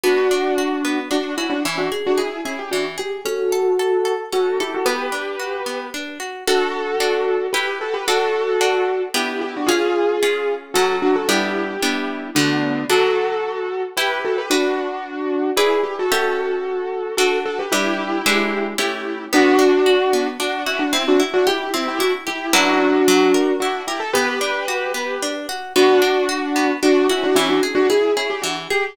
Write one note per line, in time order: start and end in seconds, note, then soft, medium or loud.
0.03 0.28 B3 medium
0.03 0.98 D4 medium
0.03 0.98 F#4 medium
0.31 0.55 D4 medium
0.58 0.82 F#4 medium
0.85 1.09 B3 medium
1.11 1.35 D4 medium
1.11 1.35 F#4 medium
1.37 1.50 C#4 medium
1.37 1.50 E4 medium
1.37 1.62 F#4 medium
1.50 1.62 D4 medium
1.50 1.62 F#4 medium
1.65 1.89 E3 medium
1.65 1.78 C#4 medium
1.65 1.78 E4 medium
1.78 1.90 D4 medium
1.78 1.90 F#4 medium
1.92 2.16 G#4 medium
2.06 2.19 D4 medium
2.06 2.19 F#4 medium
2.18 2.40 E4 medium
2.18 2.42 G#4 medium
2.18 2.40 G#4 medium
2.45 2.58 C#4 medium
2.45 2.58 E4 medium
2.45 2.70 G#4 medium
2.59 2.71 G4 medium
2.71 2.97 E3 medium
2.71 2.84 D4 medium
2.71 2.84 F#4 medium
2.98 3.25 G4 medium
2.98 3.22 G#4 medium
3.25 3.50 C#4 medium
3.25 4.12 F#4 medium
3.25 4.12 A4 medium
3.52 3.76 A4 medium
3.79 4.03 A4 medium
4.05 4.29 A4 medium
4.32 4.57 C#4 medium
4.32 4.58 F#4 medium
4.32 4.58 A4 medium
4.60 4.73 E4 medium
4.60 4.73 G4 medium
4.60 4.84 A4 medium
4.74 4.87 F#4 medium
4.74 4.87 A4 medium
4.85 5.10 B3 medium
4.85 5.86 G4 medium
4.85 5.86 B4 medium
5.12 5.36 D4 medium
5.40 5.64 F#4 medium
5.66 5.90 B3 medium
5.94 6.18 D4 medium
6.20 6.44 F#4 medium
6.47 6.96 D4 medium
6.47 7.46 F#4 medium
6.47 6.96 F#4 medium
6.47 7.46 A4 medium
6.47 6.96 A4 medium
7.00 7.48 D4 medium
7.00 7.48 F#4 medium
7.00 7.48 A4 medium
7.53 8.02 E4 medium
7.53 7.78 G4 medium
7.53 8.02 G4 medium
7.53 7.78 B4 medium
7.53 8.02 B4 medium
7.81 7.94 F#4 medium
7.81 7.94 A4 medium
7.94 8.06 G4 medium
7.94 8.06 B4 medium
8.07 8.56 D4 medium
8.07 9.02 F#4 medium
8.07 8.56 F#4 medium
8.07 9.02 A4 medium
8.07 8.56 A4 medium
8.61 9.09 D4 medium
8.61 9.09 F#4 medium
8.61 9.09 A4 medium
9.14 9.62 B3 medium
9.14 9.62 D4 medium
9.14 9.41 E4 medium
9.14 9.62 G4 medium
9.14 9.41 G4 medium
9.41 9.54 E4 medium
9.41 9.54 G4 medium
9.56 9.69 D4 medium
9.56 9.69 F#4 medium
9.66 10.17 C#4 medium
9.66 10.54 F4 medium
9.66 10.17 F4 medium
9.66 10.54 G#4 medium
9.66 10.17 G#4 medium
10.23 10.71 C#4 medium
10.23 10.71 F4 medium
10.23 10.71 G#4 medium
10.74 11.24 F#3 medium
10.74 11.24 C#4 medium
10.74 10.96 F#4 medium
10.74 10.96 A4 medium
10.74 11.24 A4 medium
11.02 11.15 D4 medium
11.02 11.15 F#4 medium
11.16 11.28 F#4 medium
11.16 11.28 A4 medium
11.28 11.77 G3 medium
11.28 11.77 B3 medium
11.28 11.77 D4 medium
11.28 12.27 E4 medium
11.28 12.27 G4 medium
11.82 12.31 G3 medium
11.82 12.31 B3 medium
11.82 12.31 D4 medium
12.35 12.84 D3 medium
12.35 12.84 A3 medium
12.35 12.84 B3 medium
12.35 12.84 D4 medium
12.35 12.84 F#4 medium
12.90 13.86 F#3 medium
12.90 13.86 D4 medium
12.90 13.82 F#4 medium
12.90 13.86 A4 medium
12.90 13.82 A4 medium
13.97 14.46 E4 medium
13.97 14.21 G4 medium
13.97 14.46 G4 medium
13.97 14.21 B4 medium
13.97 14.46 B4 medium
14.24 14.37 F#4 medium
14.24 14.37 A4 medium
14.38 14.50 G4 medium
14.38 14.50 B4 medium
14.50 15.50 D4 medium
14.50 15.47 D4 medium
14.50 15.50 F#4 medium
14.50 15.47 F#4 medium
14.50 15.47 B4 medium
15.56 15.78 E4 medium
15.56 16.05 E4 medium
15.56 15.78 G#4 medium
15.56 16.05 G#4 medium
15.56 16.05 B4 medium
15.56 16.05 D5 medium
15.83 15.96 G4 medium
15.99 16.12 F#4 medium
15.99 16.12 A4 medium
16.12 17.08 C#4 medium
16.12 17.15 F#4 medium
16.12 17.08 G4 medium
16.12 17.08 A4 medium
16.12 17.15 A4 medium
16.12 17.08 E5 medium
17.17 17.66 D4 medium
17.17 17.39 F#4 medium
17.17 17.66 F#4 medium
17.17 17.39 A4 medium
17.17 17.66 A4 medium
17.45 17.58 F#4 medium
17.45 17.58 A4 medium
17.59 17.71 G4 medium
17.59 17.72 B4 medium
17.72 18.21 G3 medium
17.72 18.21 D4 medium
17.72 18.66 E4 medium
17.72 18.66 G4 medium
17.72 18.21 B4 medium
18.26 18.74 G#3 medium
18.26 18.74 D4 medium
18.26 18.74 E4 medium
18.26 18.74 B4 medium
18.78 19.26 A3 medium
18.78 19.26 C#4 medium
18.78 19.26 E4 medium
18.78 19.24 E4 medium
18.78 19.26 G4 medium
18.78 19.24 G4 medium
19.33 19.57 B3 medium
19.33 20.27 D4 medium
19.33 20.27 F#4 loud
19.59 19.83 D4 medium
19.86 20.10 F#4 medium
20.13 20.37 B3 medium
20.40 20.64 D4 medium
20.40 20.64 F#4 medium
20.66 20.79 C#4 medium
20.66 20.79 E4 medium
20.66 20.91 F#4 medium
20.79 20.92 D4 medium
20.79 20.92 F#4 medium
20.93 21.05 C4 medium
20.93 21.17 C4 medium
20.93 21.05 E4 medium
21.08 21.20 D4 medium
21.08 21.20 F#4 medium
21.20 21.44 E4 medium
21.34 21.46 D4 medium
21.34 21.46 F#4 medium
21.47 21.69 E4 medium
21.47 21.71 G4 medium
21.47 21.69 G4 medium
21.74 21.98 C4 medium
21.74 21.87 C4 medium
21.74 21.87 E4 medium
21.88 22.00 E4 medium
21.88 22.00 G4 medium
21.99 22.12 D4 medium
21.99 22.24 E4 medium
21.99 22.12 F#4 medium
22.27 22.54 E4 medium
22.27 22.51 G4 medium
22.27 22.54 G4 medium
22.53 23.01 F#3 medium
22.53 23.01 C#4 medium
22.53 23.53 D4 medium
22.53 23.01 E4 loud
22.53 23.53 F#4 medium
22.53 23.01 B4 medium
23.08 23.32 F#3 loud
23.34 23.58 A#4 medium
23.60 23.82 D4 medium
23.60 23.86 E4 medium
23.60 23.82 F#4 medium
23.87 24.00 E4 medium
23.87 24.00 G4 medium
23.87 24.12 A#4 medium
24.00 24.12 A4 medium
24.13 24.39 B3 loud
24.13 25.29 G4 medium
24.13 25.29 B4 medium
24.41 24.65 D4 medium
24.68 24.92 F#4 medium
24.94 25.18 B3 medium
25.22 25.47 D4 medium
25.49 25.73 F#4 medium
25.76 26.00 B3 medium
25.76 26.70 D4 medium
25.76 26.70 F#4 loud
26.02 26.26 D4 medium
26.29 26.53 F#4 medium
26.56 26.80 B3 medium
26.82 27.07 D4 medium
26.82 27.07 F#4 medium
27.09 27.23 C#4 medium
27.09 27.23 E4 medium
27.09 27.34 F#4 medium
27.23 27.36 D4 medium
27.23 27.36 F#4 medium
27.35 27.60 E3 medium
27.35 27.48 C#4 medium
27.35 27.48 E4 medium
27.49 27.61 D4 medium
27.49 27.61 F#4 medium
27.63 27.87 G#4 medium
27.75 27.87 D4 medium
27.75 27.87 F#4 medium
27.90 28.12 E4 medium
27.90 28.12 G#4 medium
27.90 28.14 G#4 medium
28.16 28.29 C#4 medium
28.16 28.29 E4 medium
28.16 28.41 G#4 medium
28.30 28.42 G4 medium
28.42 28.68 E3 medium
28.42 28.54 D4 medium
28.42 28.54 F#4 medium
28.70 28.96 G4 medium
28.70 28.95 G#4 medium